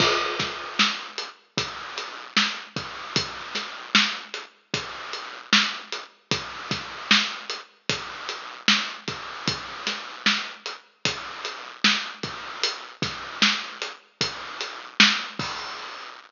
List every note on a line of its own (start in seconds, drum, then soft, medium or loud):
0.00 kick medium
0.00 crash medium
0.39 kick medium
0.39 snare medium
0.39 closed hi-hat medium
0.79 snare medium
1.18 closed hi-hat medium
1.57 kick medium
1.57 closed hi-hat medium
1.98 closed hi-hat medium
2.37 snare medium
2.76 kick medium
2.76 closed hi-hat medium
3.16 kick medium
3.16 closed hi-hat medium
3.55 snare soft
3.55 closed hi-hat medium
3.95 snare medium
4.34 closed hi-hat medium
4.74 kick medium
4.74 closed hi-hat medium
5.13 closed hi-hat medium
5.53 snare medium
5.92 closed hi-hat medium
6.31 kick medium
6.31 closed hi-hat medium
6.71 kick medium
6.71 snare soft
6.71 closed hi-hat medium
7.11 snare medium
7.50 closed hi-hat medium
7.89 kick medium
7.89 closed hi-hat medium
8.29 closed hi-hat medium
8.68 snare medium
9.08 kick medium
9.08 closed hi-hat medium
9.48 kick medium
9.48 closed hi-hat medium
9.87 snare medium
9.87 closed hi-hat medium
10.26 snare medium
10.66 closed hi-hat medium
11.05 kick medium
11.05 closed hi-hat medium
11.45 closed hi-hat medium
11.84 snare medium
12.23 kick medium
12.23 closed hi-hat medium
12.63 closed hi-hat medium
13.02 kick medium
13.02 snare soft
13.02 closed hi-hat medium
13.42 snare medium
13.82 closed hi-hat medium
14.21 kick medium
14.21 closed hi-hat medium
14.61 closed hi-hat medium
15.00 snare loud
15.39 kick medium
15.39 open hi-hat medium